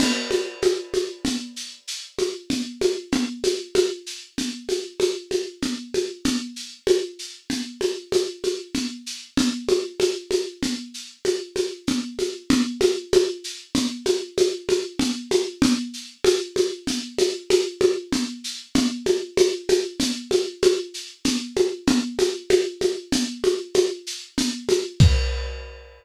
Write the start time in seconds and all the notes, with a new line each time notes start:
0.00 crash, low conga, shaker
0.31 high conga, shaker
0.62 high conga, shaker
0.94 high conga, shaker
1.25 low conga, shaker
1.56 shaker
1.88 shaker
2.18 high conga, shaker
2.50 low conga, shaker
2.81 high conga, shaker
3.12 low conga, shaker
3.44 high conga, shaker
3.75 high conga, shaker
4.06 shaker
4.38 low conga, shaker
4.69 high conga, shaker
5.00 high conga, shaker
5.31 high conga, shaker
5.62 low conga, shaker
5.94 high conga, shaker
6.25 low conga, shaker
6.56 shaker
6.87 high conga, shaker
7.19 shaker
7.50 low conga, shaker
7.81 high conga, shaker
8.12 high conga, shaker
8.44 high conga, shaker
8.74 low conga, shaker
9.06 shaker
9.37 low conga, shaker
9.69 high conga, shaker
10.00 high conga, shaker
10.31 high conga, shaker
10.63 low conga, shaker
10.94 shaker
11.25 high conga, shaker
11.56 high conga, shaker
11.87 low conga, shaker
12.19 high conga, shaker
12.50 low conga, shaker
12.81 high conga, shaker
13.13 high conga, shaker
13.44 shaker
13.75 low conga, shaker
14.06 high conga, shaker
14.38 high conga, shaker
14.69 high conga, shaker
14.99 low conga, shaker
15.31 high conga, shaker
15.62 low conga, shaker
15.93 shaker
16.24 high conga, shaker
16.56 high conga, shaker
16.87 low conga, shaker
17.18 high conga, shaker
17.50 high conga, shaker
17.81 high conga, shaker
18.12 low conga, shaker
18.44 shaker
18.75 low conga, shaker
19.06 high conga, shaker
19.37 high conga, shaker
19.69 high conga, shaker
20.00 low conga, shaker
20.31 high conga, shaker
20.62 high conga, shaker
20.94 shaker
21.25 low conga, shaker
21.56 high conga, shaker
21.87 low conga, shaker
22.19 high conga, shaker
22.50 high conga, shaker
22.81 high conga, shaker
23.12 low conga, shaker
23.44 high conga, shaker
23.74 high conga, shaker
24.07 shaker
24.38 low conga, shaker
24.69 high conga, shaker
25.00 kick, crash